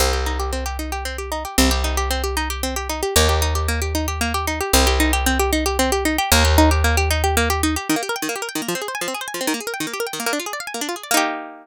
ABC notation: X:1
M:6/8
L:1/16
Q:3/8=152
K:Cm
V:1 name="Pizzicato Strings"
C2 G2 E2 G2 C2 G2 | E2 G2 C2 G2 E2 G2 | C2 G2 E2 G2 C2 G2 | E2 G2 C2 G2 E2 G2 |
B,2 G2 E2 G2 B,2 G2 | E2 G2 B,2 G2 E2 G2 | C2 G2 E2 G2 C2 G2 | E2 G2 C2 G2 E2 G2 |
B,2 G2 E2 G2 B,2 G2 | E2 G2 B,2 G2 E2 G2 | [K:Eb] E, B, G B g E, B, G B g E, B, | F, C A c a F, C A c a F, C |
E, B, A B g E, B, G B g E, B, | "^rit." B, D F A d f a B, D F A d | [B,EG]12 |]
V:2 name="Electric Bass (finger)" clef=bass
C,,12- | C,,12 | C,,12- | C,,12 |
E,,12- | E,,12 | C,,12- | C,,12 |
E,,12- | E,,12 | [K:Eb] z12 | z12 |
z12 | "^rit." z12 | z12 |]